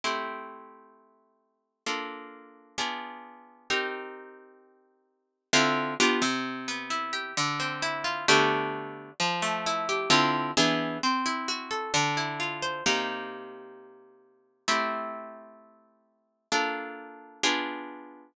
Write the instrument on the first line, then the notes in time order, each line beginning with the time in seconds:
orchestral harp
0.04 A3 C4 E4 G4
1.86 A#3 D4 F4 A4
2.78 B3 D4 F4 G#4
3.70 C4 D#4 G4 A#4
5.53 D3 C4 E4 F4
6.00 B3 D4 F4 G4
6.22 C3
6.68 B3
6.90 E4
7.13 G4
7.37 D3
7.60 C4
7.82 E4
8.04 F4
8.28 D3 A3 B3 F#4 G4
9.20 F3
9.42 A3
9.66 E4
9.89 G4
10.10 D3 C4 E4 F4
10.57 E3 B3 D4 G#4
11.03 C4
11.26 E4
11.48 F#4
11.71 A4
11.94 D3
12.17 E4
12.40 F4
12.62 C5
12.86 C3 A#3 D#4 G4
14.68 A3 C4 E4 G4
16.52 A#3 D4 F4 A4
17.43 B3 D4 F4 G#4